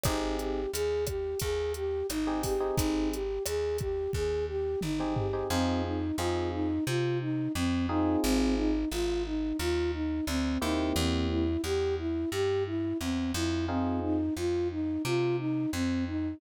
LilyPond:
<<
  \new Staff \with { instrumentName = "Flute" } { \time 4/4 \key bes \minor \tempo 4 = 88 ees'8 g'8 aes'8 g'8 aes'8 g'8 ees'8 g'8 | ees'8 g'8 aes'8 g'8 aes'8 g'8 ees'8 g'8 | \key f \minor c'8 ees'8 f'8 ees'8 f'8 ees'8 c'8 ees'8 | c'8 ees'8 f'8 ees'8 f'8 ees'8 c'8 ees'8 |
c'8 e'8 g'8 e'8 g'8 e'8 c'8 e'8 | c'8 ees'8 f'8 ees'8 f'8 ees'8 c'8 ees'8 | }
  \new Staff \with { instrumentName = "Electric Piano 1" } { \time 4/4 \key bes \minor <c' ees' g' aes'>2.~ <c' ees' g' aes'>16 <c' ees' g' aes'>8 <c' ees' g' aes'>16~ | <c' ees' g' aes'>2.~ <c' ees' g' aes'>16 <c' ees' g' aes'>8 <c' ees' g' aes'>16 | \key f \minor <c' ees' f' aes'>4 <c' ees' f' aes'>2~ <c' ees' f' aes'>8 <c' ees' f' aes'>8~ | <c' ees' f' aes'>2.~ <c' ees' f' aes'>8 <bes c' e' g'>8~ |
<bes c' e' g'>1 | <c' ees' f' aes'>1 | }
  \new Staff \with { instrumentName = "Electric Bass (finger)" } { \clef bass \time 4/4 \key bes \minor aes,,4 ees,4 ees,4 aes,,4 | aes,,4 ees,4 ees,4 aes,,4 | \key f \minor f,4 f,4 c4 f,4 | aes,,4 aes,,4 ees,4 d,8 ees,8 |
e,4 e,4 g,4 e,8 f,8~ | f,4 f,4 c4 f,4 | }
  \new DrumStaff \with { instrumentName = "Drums" } \drummode { \time 4/4 <hh bd ss>8 hh8 hh8 <hh bd ss>8 <hh bd>8 hh8 <hh ss>8 <hho bd>8 | <hh bd>8 hh8 <hh ss>8 <hh bd>8 bd4 toml8 tomfh8 | r4 r4 r4 r4 | r4 r4 r4 r4 |
r4 r4 r4 r4 | r4 r4 r4 r4 | }
>>